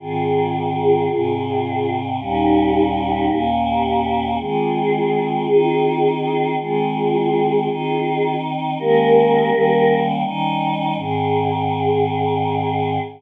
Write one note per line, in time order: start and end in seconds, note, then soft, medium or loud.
0.00 1.08 G#2 medium
0.00 1.08 D#3 loud
0.00 1.08 C4 medium
0.00 1.94 F4 loud
0.00 1.94 G#4 loud
1.10 2.18 G#2 medium
1.10 2.18 C3 medium
1.10 2.18 C4 medium
2.19 3.27 D#2 loud
2.19 3.27 A#2 loud
2.19 3.27 G3 medium
2.19 3.27 C#4 loud
2.19 3.41 D#4 loud
2.19 3.41 G4 loud
3.28 4.37 D#2 medium
3.28 4.37 A#2 medium
3.28 4.37 A#3 loud
3.28 4.37 C#4 medium
3.66 4.25 G4 loud
4.39 5.47 D#3 medium
4.39 5.47 G#3 medium
4.39 5.47 C4 medium
4.39 6.52 F4 loud
4.39 6.52 G#4 loud
5.47 6.56 D#3 medium
5.47 6.56 C4 loud
5.47 6.56 D#4 medium
6.58 7.68 D#3 medium
6.58 7.68 G#3 medium
6.58 7.68 C4 medium
6.58 8.35 F4 loud
6.58 8.35 G#4 loud
7.68 8.77 D#3 medium
7.68 8.77 C4 medium
7.68 8.77 D#4 medium
8.79 9.50 D#3 loud
8.79 9.51 G#3 loud
8.79 9.50 A#3 loud
8.79 9.50 C#4 medium
8.79 9.98 G4 loud
8.79 9.98 A#4 loud
9.51 10.23 D#3 loud
9.51 10.23 G3 loud
9.51 10.23 A#3 medium
9.51 10.23 C#4 medium
10.24 10.95 D#3 loud
10.24 10.96 G3 medium
10.24 10.96 C#4 medium
10.24 10.96 D#4 loud
10.96 12.98 G#2 loud
10.96 12.98 D#3 loud
10.96 12.98 C4 medium
10.96 13.00 G#4 loud